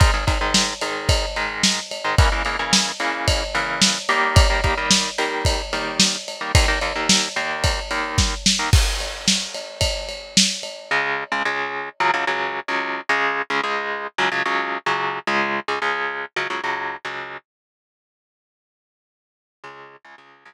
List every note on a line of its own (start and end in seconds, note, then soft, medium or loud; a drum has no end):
0.00 0.11 G#2 medium
0.00 0.11 D#3 medium
0.00 0.11 G#3 medium
0.00 kick loud
0.00 ride medium
0.14 0.25 G#2 medium
0.14 0.25 D#3 medium
0.14 0.25 G#3 medium
0.27 0.38 G#2 medium
0.27 0.38 D#3 medium
0.27 0.38 G#3 medium
0.27 kick medium
0.27 ride medium
0.41 0.74 G#2 medium
0.41 0.74 D#3 medium
0.41 0.74 G#3 medium
0.54 snare loud
0.81 1.25 G#2 medium
0.81 1.25 D#3 medium
0.81 1.25 G#3 medium
0.81 ride medium
1.09 kick medium
1.09 ride loud
1.36 1.80 G#2 medium
1.36 1.80 D#3 medium
1.36 1.80 G#3 medium
1.36 ride medium
1.63 snare loud
1.91 ride medium
2.04 2.15 G#2 medium
2.04 2.15 D#3 medium
2.04 2.15 G#3 medium
2.18 2.29 C#3 medium
2.18 2.29 E3 loud
2.18 2.29 A#3 loud
2.18 kick loud
2.18 ride medium
2.32 2.43 C#3 medium
2.32 2.43 E3 medium
2.32 2.43 A#3 medium
2.45 2.56 C#3 medium
2.45 2.56 E3 medium
2.45 2.56 A#3 medium
2.45 ride medium
2.59 2.92 C#3 medium
2.59 2.92 E3 medium
2.59 2.92 A#3 medium
2.73 snare loud
3.00 3.44 C#3 medium
3.00 3.44 E3 medium
3.00 3.44 A#3 medium
3.00 ride medium
3.28 kick medium
3.28 ride loud
3.55 3.98 C#3 medium
3.55 3.98 E3 medium
3.55 3.98 A#3 medium
3.55 ride medium
3.82 snare loud
4.09 4.47 D#3 loud
4.09 4.47 G3 medium
4.09 4.47 A#3 medium
4.09 ride medium
4.36 kick loud
4.36 ride loud
4.50 4.61 D#3 medium
4.50 4.61 G3 medium
4.50 4.61 A#3 medium
4.64 4.75 D#3 medium
4.64 4.75 G3 medium
4.64 4.75 A#3 medium
4.64 kick medium
4.64 ride medium
4.78 5.10 D#3 medium
4.78 5.10 G3 medium
4.78 5.10 A#3 medium
4.91 snare loud
5.18 5.62 D#3 medium
5.18 5.62 G3 medium
5.18 5.62 A#3 medium
5.18 ride medium
5.45 kick medium
5.45 ride loud
5.73 6.16 D#3 medium
5.73 6.16 G3 medium
5.73 6.16 A#3 medium
5.73 ride medium
6.00 snare loud
6.28 ride medium
6.41 6.52 D#3 medium
6.41 6.52 G3 medium
6.41 6.52 A#3 medium
6.55 6.66 D#2 medium
6.55 6.66 D#3 loud
6.55 6.66 A#3 medium
6.55 kick loud
6.55 ride loud
6.68 6.79 D#2 medium
6.68 6.79 D#3 medium
6.68 6.79 A#3 medium
6.81 6.93 D#2 medium
6.81 6.93 D#3 medium
6.81 6.93 A#3 medium
6.81 ride medium
6.95 7.28 D#2 medium
6.95 7.28 D#3 medium
6.95 7.28 A#3 medium
7.09 snare loud
7.36 7.80 D#2 medium
7.36 7.80 D#3 medium
7.36 7.80 A#3 medium
7.36 ride medium
7.64 kick medium
7.64 ride loud
7.91 8.34 D#2 medium
7.91 8.34 D#3 medium
7.91 8.34 A#3 medium
7.91 ride medium
8.18 kick medium
8.18 snare medium
8.46 snare loud
8.59 8.70 D#2 medium
8.59 8.70 D#3 medium
8.59 8.70 A#3 medium
8.73 kick loud
8.73 crash loud
9.00 ride medium
9.28 snare loud
9.54 ride medium
9.81 kick medium
9.81 ride loud
10.09 ride medium
10.37 snare loud
10.63 ride medium
10.91 11.24 C#2 medium
10.91 11.24 C#3 loud
10.91 11.24 G#3 loud
11.32 11.43 C#2 medium
11.32 11.43 C#3 medium
11.32 11.43 G#3 medium
11.45 11.89 C#2 medium
11.45 11.89 C#3 medium
11.45 11.89 G#3 medium
12.00 12.11 C#2 loud
12.00 12.11 C#3 loud
12.00 12.11 F#3 loud
12.14 12.25 C#2 medium
12.14 12.25 C#3 medium
12.14 12.25 F#3 medium
12.27 12.60 C#2 medium
12.27 12.60 C#3 medium
12.27 12.60 F#3 medium
12.68 13.01 C#2 medium
12.68 13.01 C#3 medium
12.68 13.01 F#3 medium
13.09 13.42 C#2 loud
13.09 13.42 C#3 loud
13.09 13.42 G#3 loud
13.50 13.61 C#2 medium
13.50 13.61 C#3 medium
13.50 13.61 G#3 medium
13.64 14.07 C#2 medium
13.64 14.07 C#3 medium
13.64 14.07 G#3 loud
14.18 14.29 C#2 loud
14.18 14.29 C#3 loud
14.18 14.29 F#3 loud
14.32 14.43 C#2 medium
14.32 14.43 C#3 medium
14.32 14.43 F#3 medium
14.45 14.78 C#2 medium
14.45 14.78 C#3 medium
14.45 14.78 F#3 medium
14.86 15.19 C#2 medium
14.86 15.19 C#3 loud
14.86 15.19 F#3 medium
15.27 15.60 C#2 loud
15.27 15.60 C#3 loud
15.27 15.60 G#3 loud
15.68 15.79 C#2 medium
15.68 15.79 C#3 medium
15.68 15.79 G#3 medium
15.82 16.25 C#2 medium
15.82 16.25 C#3 medium
15.82 16.25 G#3 medium
16.36 16.47 C#2 medium
16.36 16.47 C#3 loud
16.36 16.47 F#3 loud
16.50 16.61 C#2 medium
16.50 16.61 C#3 medium
16.50 16.61 F#3 loud
16.64 16.96 C#2 medium
16.64 16.96 C#3 medium
16.64 16.96 F#3 medium
17.05 17.37 C#2 medium
17.05 17.37 C#3 medium
17.05 17.37 F#3 medium
19.64 19.96 C#2 loud
19.64 19.96 C#3 loud
19.64 19.96 G#3 loud
20.05 20.15 C#2 medium
20.05 20.15 C#3 medium
20.05 20.15 G#3 medium
20.18 20.44 C#2 medium
20.18 20.44 C#3 medium
20.18 20.44 G#3 medium
20.45 20.54 C#2 loud
20.45 20.54 C#3 loud
20.45 20.54 G#3 medium